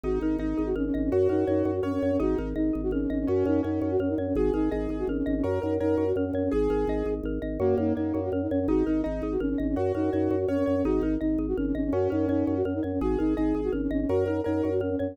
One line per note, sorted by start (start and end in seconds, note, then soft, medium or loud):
0.04 0.19 G#1 loud
0.04 0.37 D#4 medium
0.04 0.19 F#4 medium
0.04 0.57 G#4 medium
0.21 0.37 G#1 medium
0.21 0.37 D#4 medium
0.21 0.75 A#4 medium
0.39 0.54 G#1 loud
0.39 0.69 D#4 medium
0.39 0.63 D#4 medium
0.39 0.93 D#5 medium
0.58 0.74 G#1 medium
0.58 1.09 G#4 medium
0.66 0.75 F#4 medium
0.76 0.91 G#1 medium
0.76 0.85 C#4 medium
0.76 1.10 A#4 medium
0.86 0.94 C#4 medium
0.94 1.10 G#1 loud
0.94 1.03 C#4 medium
0.94 1.11 D#5 medium
1.04 1.12 C#4 medium
1.12 1.28 F#2 loud
1.12 1.74 F#4 medium
1.12 1.65 F#4 medium
1.12 1.28 F#4 medium
1.29 1.44 F#2 medium
1.29 1.45 D#4 medium
1.29 1.82 A#4 medium
1.47 1.63 F#2 loud
1.47 1.72 D#4 medium
1.47 2.02 C#5 medium
1.65 1.81 F#2 loud
1.65 2.17 F#4 medium
1.75 1.83 F#4 medium
1.83 1.98 F#2 medium
1.83 1.92 C#4 loud
1.83 2.17 A#4 medium
1.83 2.16 C#5 medium
1.93 2.02 C#4 medium
2.02 2.18 F#2 loud
2.02 2.11 C#4 medium
2.02 2.20 C#5 medium
2.12 2.20 C#4 medium
2.20 2.35 G#1 loud
2.20 2.49 D#4 medium
2.20 2.38 F#4 medium
2.20 2.73 G#4 medium
2.38 2.54 G#1 loud
2.38 2.53 D#4 medium
2.38 2.92 A#4 medium
2.56 2.71 G#1 medium
2.56 2.82 D#4 medium
2.56 3.09 D#5 medium
2.73 2.91 G#1 loud
2.73 3.25 G#4 medium
2.83 2.92 F#4 medium
2.91 3.07 G#1 loud
2.91 3.01 C#4 medium
2.91 3.26 A#4 medium
3.01 3.10 C#4 medium
3.10 3.26 G#1 loud
3.10 3.19 C#4 medium
3.10 3.27 D#5 medium
3.20 3.28 C#4 medium
3.27 3.44 F#2 loud
3.27 3.61 C#4 loud
3.27 3.81 F#4 medium
3.27 3.45 F#4 loud
3.45 3.61 F#2 loud
3.45 3.62 D#4 medium
3.45 3.99 A#4 medium
3.63 3.80 F#2 loud
3.63 3.93 C#4 medium
3.63 3.90 D#4 medium
3.63 4.18 C#5 medium
3.82 3.97 F#2 loud
3.82 4.33 F#4 medium
3.91 4.00 F#4 loud
3.99 4.15 F#2 medium
3.99 4.09 C#4 medium
3.99 4.34 A#4 medium
4.09 4.18 D#4 medium
4.18 4.33 F#2 medium
4.18 4.27 C#4 medium
4.18 4.36 C#5 medium
4.27 4.36 C#4 medium
4.35 4.51 G#1 loud
4.35 4.53 F#4 medium
4.35 4.71 G#4 medium
4.35 4.90 G#4 medium
4.54 4.69 G#1 loud
4.54 4.69 D#4 medium
4.54 5.09 A#4 medium
4.71 4.87 G#1 loud
4.71 4.97 D#4 medium
4.71 5.06 G#4 medium
4.71 5.26 D#5 medium
4.89 5.04 G#1 medium
4.89 5.42 G#4 medium
4.99 5.08 F#4 medium
5.07 5.23 G#1 medium
5.07 5.17 C#4 medium
5.07 5.43 A#4 medium
5.18 5.26 C#4 medium
5.26 5.42 G#1 loud
5.26 5.35 C#4 medium
5.26 5.43 D#5 medium
5.36 5.45 C#4 medium
5.43 5.59 F#2 loud
5.43 5.97 F#4 medium
5.43 5.59 F#4 medium
5.43 5.74 A#4 medium
5.62 5.79 F#2 loud
5.62 5.77 D#4 medium
5.62 6.16 A#4 medium
5.80 5.96 F#2 loud
5.80 6.05 D#4 medium
5.80 6.10 A#4 medium
5.80 6.34 C#5 medium
5.97 6.13 F#2 medium
5.97 6.49 F#4 medium
6.07 6.16 F#4 medium
6.16 6.31 F#2 medium
6.16 6.25 C#4 medium
6.16 6.51 A#4 medium
6.26 6.35 C#4 medium
6.33 6.49 F#2 loud
6.33 6.44 C#4 medium
6.33 6.52 C#5 medium
6.44 6.53 C#4 medium
6.52 6.68 G#1 loud
6.52 7.09 G#4 loud
6.52 7.06 G#4 medium
6.52 7.14 G#4 loud
6.70 6.85 G#1 loud
6.70 7.25 A#4 medium
6.87 7.03 G#1 loud
6.87 7.42 D#5 medium
7.06 7.21 G#1 medium
7.06 7.58 G#4 medium
7.23 7.39 G#1 loud
7.23 7.60 A#4 medium
7.42 7.58 G#1 loud
7.42 7.59 D#5 medium
7.60 7.75 F#2 loud
7.60 7.93 A#3 loud
7.60 7.78 F#4 medium
7.60 7.77 F#4 loud
7.78 7.93 F#2 loud
7.78 7.94 D#4 medium
7.78 7.96 A#4 medium
7.95 8.12 F#2 medium
7.95 8.29 A#3 medium
7.95 8.20 D#4 medium
7.95 8.15 C#5 medium
8.14 8.30 F#2 loud
8.14 8.32 F#4 medium
8.24 8.33 F#4 medium
8.32 8.47 F#2 loud
8.32 8.42 C#4 medium
8.32 8.51 A#4 medium
8.42 8.51 D#4 medium
8.51 8.66 F#2 loud
8.51 8.60 C#4 medium
8.51 8.68 C#5 medium
8.60 8.69 C#4 medium
8.68 8.83 G#1 loud
8.68 9.01 D#4 medium
8.68 8.84 F#4 medium
8.68 8.87 G#4 medium
8.86 9.02 G#1 medium
8.86 9.02 D#4 medium
8.86 9.05 A#4 medium
9.04 9.21 G#1 loud
9.04 9.33 D#4 medium
9.04 9.27 D#4 medium
9.04 9.22 D#5 medium
9.22 9.37 G#1 medium
9.22 9.41 G#4 medium
9.32 9.40 F#4 medium
9.40 9.56 G#1 medium
9.40 9.49 C#4 medium
9.40 9.58 A#4 medium
9.50 9.59 C#4 medium
9.58 9.75 G#1 loud
9.58 9.68 C#4 medium
9.58 9.75 D#5 medium
9.68 9.77 C#4 medium
9.76 9.92 F#2 loud
9.76 10.39 F#4 medium
9.76 9.92 F#4 medium
9.76 9.95 F#4 medium
9.95 10.10 F#2 medium
9.95 10.10 D#4 medium
9.95 10.13 A#4 medium
10.12 10.29 F#2 loud
10.12 10.36 D#4 medium
10.12 10.31 C#5 medium
10.31 10.46 F#2 loud
10.31 10.49 F#4 medium
10.40 10.48 F#4 medium
10.48 10.64 F#2 medium
10.48 10.58 C#4 loud
10.48 10.67 A#4 medium
10.48 10.81 C#5 medium
10.58 10.67 C#4 medium
10.66 10.83 F#2 loud
10.66 10.76 C#4 medium
10.66 10.83 C#5 medium
10.76 10.85 C#4 medium
10.85 11.00 G#1 loud
10.85 11.14 D#4 medium
10.85 11.02 F#4 medium
10.85 11.03 G#4 medium
11.02 11.17 G#1 loud
11.02 11.18 D#4 medium
11.02 11.21 A#4 medium
11.21 11.37 G#1 medium
11.21 11.46 D#4 medium
11.21 11.39 D#5 medium
11.38 11.54 G#1 loud
11.38 11.57 G#4 medium
11.48 11.57 F#4 medium
11.57 11.73 G#1 loud
11.57 11.66 C#4 medium
11.57 11.75 A#4 medium
11.66 11.75 C#4 medium
11.75 11.90 G#1 loud
11.75 11.84 C#4 medium
11.75 11.92 D#5 medium
11.85 11.93 C#4 medium
11.93 12.08 F#2 loud
11.93 12.27 C#4 loud
11.93 12.11 F#4 medium
11.93 12.10 F#4 loud
12.10 12.27 F#2 loud
12.10 12.26 D#4 medium
12.10 12.28 A#4 medium
12.28 12.44 F#2 loud
12.28 12.58 C#4 medium
12.28 12.55 D#4 medium
12.28 12.47 C#5 medium
12.47 12.63 F#2 loud
12.47 12.65 F#4 medium
12.56 12.65 F#4 loud
12.65 12.80 F#2 medium
12.65 12.74 C#4 medium
12.65 12.83 A#4 medium
12.75 12.83 D#4 medium
12.83 12.99 F#2 medium
12.83 12.92 C#4 medium
12.83 13.00 C#5 medium
12.93 13.01 C#4 medium
13.01 13.17 G#1 loud
13.01 13.18 F#4 medium
13.01 13.36 G#4 medium
13.01 13.19 G#4 medium
13.19 13.35 G#1 loud
13.19 13.34 D#4 medium
13.19 13.37 A#4 medium
13.37 13.53 G#1 loud
13.37 13.61 D#4 medium
13.37 13.71 G#4 medium
13.37 13.55 D#5 medium
13.55 13.70 G#1 medium
13.55 13.73 G#4 medium
13.64 13.72 F#4 medium
13.73 13.88 G#1 medium
13.73 13.81 C#4 medium
13.73 13.91 A#4 medium
13.82 13.91 C#4 medium
13.91 14.06 G#1 loud
13.91 14.00 C#4 medium
13.91 14.08 D#5 medium
14.01 14.09 C#4 medium
14.09 14.25 F#2 loud
14.09 14.28 F#4 medium
14.09 14.24 F#4 medium
14.09 14.40 A#4 medium
14.26 14.41 F#2 loud
14.26 14.41 D#4 medium
14.26 14.46 A#4 medium
14.44 14.62 F#2 loud
14.44 14.70 D#4 medium
14.44 14.74 A#4 medium
14.44 14.64 C#5 medium
14.63 14.80 F#2 medium
14.63 14.81 F#4 medium
14.72 14.81 F#4 medium
14.80 14.96 F#2 medium
14.80 14.90 C#4 medium
14.80 14.99 A#4 medium
14.90 14.99 C#4 medium
14.99 15.15 F#2 loud
14.99 15.08 C#4 medium
14.99 15.16 C#5 medium
15.08 15.17 C#4 medium